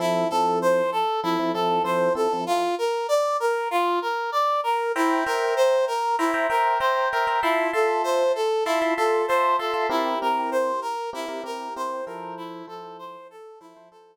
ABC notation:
X:1
M:4/4
L:1/16
Q:1/4=97
K:F
V:1 name="Brass Section"
E2 A2 c2 A2 E2 A2 c2 A2 | F2 B2 d2 B2 F2 B2 d2 B2 | E2 B2 c2 B2 E2 B2 c2 B2 | E2 A2 c2 A2 E2 A2 c2 A2 |
E2 B2 c2 B2 E2 B2 c2 B2 | E2 A2 c2 A2 E2 A2 z4 |]
V:2 name="Electric Piano 1"
[F,CEA]2 [F,CEA]6 [F,CEA] [F,CEA] [F,CEA]2 [F,CEA]2 [F,CEA] [F,CEA] | z16 | [cegb]2 [cegb]6 [cegb] [cegb] [cegb]2 [cegb]2 [cegb] [cegb] | [Feac']2 [Feac']6 [Feac'] [Feac'] [Feac']2 [Feac']2 [Feac'] [Feac'] |
[CEGB]2 [CEGB]6 [CEGB] [CEGB] [CEGB]2 [CEGB]2 [F,EAc]2- | [F,EAc]2 [F,EAc]6 [F,EAc] [F,EAc] [F,EAc]2 z4 |]